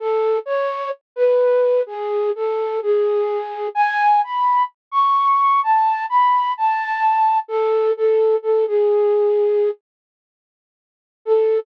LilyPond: \new Staff { \time 4/4 \key a \major \tempo 4 = 64 a'8 cis''8 r16 b'8. gis'8 a'8 gis'4 | gis''8 b''8 r16 cis'''8. a''8 b''8 a''4 | a'8 a'8 a'16 gis'4~ gis'16 r4. | a'4 r2. | }